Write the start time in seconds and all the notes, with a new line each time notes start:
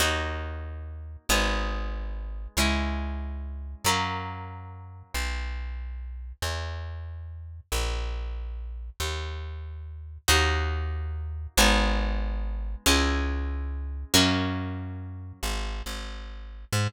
0.00 D#2 A#3 D#4 F#4
1.29 G#1 G#3 B3 D#4
2.57 C#2 G#3 C#4 E4
3.84 F#2 F#3 A#3 C#4
5.14 B1
6.42 E2
7.72 A#1
9.00 D#2
10.28 D#2 A#3 D#4 F#4
11.57 G#1 G#3 B3 D#4
12.86 C#2 G#3 C#4 E4
14.14 F#2 F#3 A#3 C#4
15.43 G#1
15.86 G#1
16.72 G#2